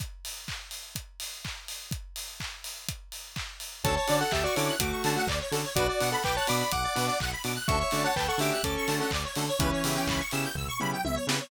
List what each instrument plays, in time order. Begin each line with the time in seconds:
0.00 kick, closed hi-hat
0.25 open hi-hat
0.48 kick, clap
0.71 open hi-hat
0.95 kick, closed hi-hat
1.20 open hi-hat
1.45 kick, clap
1.68 open hi-hat
1.91 kick, closed hi-hat
2.16 open hi-hat
2.40 kick, clap
2.64 open hi-hat
2.89 kick, closed hi-hat
3.12 open hi-hat
3.36 kick, clap
3.60 open hi-hat
3.84 synth bass 1 D2, lead 2 (sawtooth) C#4 D4 F#4 A4, lead 1 (square) A4 C#5 A5, kick, closed hi-hat
3.96 lead 1 (square) C#5 A5
4.07 synth bass 1 D3, lead 2 (sawtooth) C#4 D4 F#4 A4, lead 1 (square) D5, open hi-hat
4.20 lead 1 (square) A4 F#5
4.31 synth bass 1 D2, lead 1 (square) G4 E5 A5, kick, clap
4.44 lead 1 (square) F#4 D5 C#6
4.55 synth bass 1 D3, lead 2 (sawtooth) C#4 D4 F#4 A4, lead 1 (square) E4 C#5 D6, open hi-hat
4.68 lead 1 (square) F#6
4.79 synth bass 1 D2, lead 1 (square) A3 F#4 D6, kick, closed hi-hat
4.92 lead 1 (square) C#6
5.04 synth bass 1 D3, lead 2 (sawtooth) C#4 D4 F#4 A4, lead 1 (square) A5, open hi-hat
5.16 lead 1 (square) A3 F#4 F#5
5.27 synth bass 1 D2, lead 1 (square) D5, kick, clap
5.41 lead 1 (square) C#5
5.51 synth bass 1 D3, lead 2 (sawtooth) C#4 D4 F#4 A4, lead 1 (square) A4, open hi-hat
5.64 lead 1 (square) C#5
5.75 synth bass 1 B1, lead 2 (sawtooth) B3 D4 F#4, lead 1 (square) F#4 B4 D5, kick, closed hi-hat
5.88 lead 1 (square) F#4 D5
6.00 synth bass 1 B2, lead 2 (sawtooth) B3 D4 F#4, lead 1 (square) F#5, open hi-hat
6.12 lead 1 (square) A4 F#5 B5
6.23 synth bass 1 B1, lead 1 (square) B4 G5 D6, kick, clap
6.36 lead 1 (square) C#5 A5 F#6
6.47 synth bass 1 B2, lead 2 (sawtooth) B3 D4 F#4, lead 1 (square) D5 B5 D6, open hi-hat
6.60 lead 1 (square) B5
6.71 synth bass 1 B1, lead 1 (square) F#5 D6, kick, closed hi-hat
6.83 lead 1 (square) D5
6.95 synth bass 1 B2, lead 2 (sawtooth) B3 D4 F#4, lead 1 (square) B4, open hi-hat
7.07 lead 1 (square) D5 F#5 D6
7.20 synth bass 1 B1, lead 1 (square) F#5, kick, clap
7.32 lead 1 (square) B5
7.44 synth bass 1 B2, lead 2 (sawtooth) B3 D4 F#4, lead 1 (square) D6, open hi-hat
7.56 lead 1 (square) F#6
7.68 synth bass 1 D2, lead 2 (sawtooth) A3 C#4 D4 F#4, lead 1 (square) A4 E5 C#6, kick, closed hi-hat
7.80 lead 1 (square) C#5 E5 C#6
7.91 synth bass 1 D3, lead 2 (sawtooth) A3 C#4 D4 F#4, lead 1 (square) D5, open hi-hat
8.04 lead 1 (square) C#5 F#5 A5
8.16 synth bass 1 D2, lead 1 (square) B4 G5 A5, kick, clap
8.28 lead 1 (square) A4 F#5 C#6
8.38 synth bass 1 D3, lead 2 (sawtooth) A3 C#4 D4 F#4, lead 1 (square) G4 E5 D6, open hi-hat
8.52 lead 1 (square) F#6
8.63 synth bass 1 D2, lead 1 (square) C#4 A4 D6, kick, closed hi-hat
8.77 lead 1 (square) C#6
8.87 synth bass 1 D3, lead 2 (sawtooth) A3 C#4 D4 F#4, lead 1 (square) A5, open hi-hat
9.00 lead 1 (square) C#4 A4 F#5
9.11 synth bass 1 D2, lead 1 (square) D5, kick, clap
9.24 lead 1 (square) C#5
9.36 synth bass 1 D3, lead 2 (sawtooth) A3 C#4 D4 F#4, lead 1 (square) A4, open hi-hat
9.48 lead 1 (square) C#5
9.59 synth bass 1 C#2, lead 1 (square) E3 C#4 B4, lead 2 (sawtooth) B3 C#4 E4 G4, kick, closed hi-hat
9.72 lead 1 (square) C#5
9.84 synth bass 1 C#3, lead 2 (sawtooth) B3 C#4 E4 G4, lead 1 (square) E5, open hi-hat
9.96 lead 1 (square) G5
10.07 synth bass 1 C#2, lead 1 (square) B5, kick, clap
10.20 lead 1 (square) C#6
10.31 synth bass 1 C#3, lead 2 (sawtooth) B3 C#4 E4 G4, lead 1 (square) E6, open hi-hat
10.44 lead 1 (square) G6
10.55 synth bass 1 C#2, lead 1 (square) E6, kick, floor tom
10.68 lead 1 (square) C#6
10.80 synth bass 1 C#3, lead 2 (sawtooth) B3 C#4 E4 G4, lead 1 (square) B5, mid tom
10.93 lead 1 (square) G5
11.04 synth bass 1 C#2, lead 1 (square) E5, high tom
11.15 lead 1 (square) C#5
11.27 synth bass 1 C#3, lead 2 (sawtooth) B3 C#4 E4 G4, lead 1 (square) B4, snare
11.40 lead 1 (square) C#5